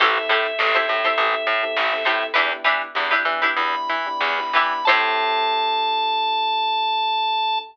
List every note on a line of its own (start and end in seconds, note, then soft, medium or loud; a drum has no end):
0.00 0.18 A1 medium
0.00 0.13 C4 medium
0.00 0.13 E4 medium
0.00 0.24 E4 medium
0.00 0.13 G4 medium
0.00 0.24 G4 medium
0.00 0.13 A4 medium
0.00 0.24 A4 medium
0.00 0.24 C5 loud
0.00 2.26 E5 medium
0.00 kick loud
0.00 crash loud
0.16 0.51 C4 medium
0.16 0.51 E4 medium
0.16 0.51 G4 medium
0.16 0.51 A4 medium
0.16 closed hi-hat medium
0.29 0.47 A2 medium
0.29 0.66 E4 medium
0.29 0.66 G4 medium
0.29 0.66 A4 medium
0.29 0.66 C5 medium
0.29 closed hi-hat medium
0.46 snare soft
0.46 closed hi-hat medium
0.59 0.77 A1 medium
0.59 0.72 C4 medium
0.59 0.72 E4 medium
0.59 0.72 G4 medium
0.59 0.72 A4 medium
0.59 snare loud
0.74 0.86 C4 medium
0.74 0.86 E4 medium
0.74 0.97 E4 medium
0.74 0.86 G4 medium
0.74 0.97 G4 medium
0.74 0.86 A4 medium
0.74 0.97 A4 medium
0.74 0.97 C5 medium
0.74 closed hi-hat medium
0.88 1.07 A2 medium
0.88 1.01 C4 medium
0.88 1.01 E4 medium
0.88 1.01 G4 medium
0.88 1.01 A4 medium
0.88 closed hi-hat medium
1.04 1.15 C4 medium
1.04 1.15 E4 medium
1.04 1.50 E4 medium
1.04 1.15 G4 medium
1.04 1.50 G4 medium
1.04 1.15 A4 medium
1.04 1.50 A4 medium
1.04 1.50 C5 medium
1.04 closed hi-hat medium
1.18 1.35 A1 medium
1.18 1.53 C4 medium
1.18 1.53 E4 medium
1.18 1.53 G4 medium
1.18 1.53 A4 medium
1.18 kick medium
1.18 closed hi-hat loud
1.34 closed hi-hat medium
1.47 1.64 A2 medium
1.47 closed hi-hat medium
1.63 1.86 C4 medium
1.63 1.86 E4 medium
1.63 1.86 G4 medium
1.63 1.86 A4 medium
1.63 closed hi-hat medium
1.76 1.94 A1 medium
1.76 snare loud
1.93 2.03 C4 medium
1.93 2.03 E4 medium
1.93 2.03 G4 medium
1.93 2.03 A4 medium
1.93 snare medium
1.93 closed hi-hat medium
2.05 2.24 A2 medium
2.05 2.30 C4 medium
2.05 2.30 E4 medium
2.05 2.29 E4 medium
2.05 2.30 G4 medium
2.05 2.29 G4 medium
2.05 2.29 A4 medium
2.05 2.30 A4 medium
2.05 2.29 C5 medium
2.05 closed hi-hat medium
2.22 closed hi-hat medium
2.34 2.53 E2 medium
2.34 2.48 B3 medium
2.34 2.48 D4 medium
2.34 2.58 D4 medium
2.34 2.58 E4 medium
2.34 2.48 E4 medium
2.34 2.58 G4 medium
2.34 2.48 G4 medium
2.34 2.58 B4 loud
2.34 kick loud
2.34 closed hi-hat loud
2.51 2.87 B3 medium
2.51 2.87 D4 medium
2.51 2.87 E4 medium
2.51 2.87 G4 medium
2.51 closed hi-hat medium
2.64 2.82 E3 medium
2.64 3.01 D4 medium
2.64 3.01 E4 medium
2.64 3.01 G4 medium
2.64 3.01 B4 medium
2.64 closed hi-hat medium
2.81 closed hi-hat medium
2.95 3.14 E2 medium
2.95 3.08 B3 medium
2.95 3.08 D4 medium
2.95 3.08 E4 medium
2.95 3.08 G4 medium
2.95 snare loud
3.11 3.23 B3 medium
3.11 3.23 D4 medium
3.11 3.35 D4 medium
3.11 3.23 E4 medium
3.11 3.35 E4 medium
3.11 3.35 G4 medium
3.11 3.23 G4 medium
3.11 3.35 B4 medium
3.11 closed hi-hat medium
3.25 3.44 E3 medium
3.25 3.39 B3 medium
3.25 3.39 D4 medium
3.25 3.39 E4 medium
3.25 3.39 G4 medium
3.25 closed hi-hat medium
3.42 3.54 B3 medium
3.42 3.54 D4 medium
3.42 3.91 D4 medium
3.42 3.54 E4 medium
3.42 3.91 E4 medium
3.42 3.91 G4 medium
3.42 3.54 G4 medium
3.42 3.91 B4 medium
3.42 closed hi-hat medium
3.57 3.75 E2 medium
3.57 3.96 B3 medium
3.57 3.96 D4 medium
3.57 3.96 E4 medium
3.57 3.96 G4 medium
3.57 4.85 B5 medium
3.57 kick medium
3.57 closed hi-hat loud
3.74 closed hi-hat medium
3.88 4.09 E3 medium
3.88 snare soft
3.88 closed hi-hat medium
4.06 4.31 B3 medium
4.06 4.31 D4 medium
4.06 4.31 E4 medium
4.06 4.31 G4 medium
4.06 closed hi-hat medium
4.21 4.40 E2 medium
4.21 snare loud
4.39 4.51 B3 medium
4.39 4.51 D4 medium
4.39 4.51 E4 medium
4.39 4.51 G4 medium
4.39 snare medium
4.39 closed hi-hat medium
4.53 4.73 E3 medium
4.53 4.81 B3 medium
4.53 4.81 D4 medium
4.53 4.82 D4 medium
4.53 4.81 E4 medium
4.53 4.82 E4 medium
4.53 4.81 G4 medium
4.53 4.82 G4 medium
4.53 4.82 B4 medium
4.53 snare soft
4.53 closed hi-hat medium
4.72 snare soft
4.72 closed hi-hat medium
4.85 7.62 A2 loud
4.85 7.60 C4 loud
4.85 7.60 E4 loud
4.85 7.60 G4 loud
4.85 7.61 G4 medium
4.85 7.60 A4 loud
4.85 7.61 A4 loud
4.85 7.61 C5 loud
4.85 7.59 A5 loud
4.85 kick loud
4.85 crash loud
4.89 7.61 E4 loud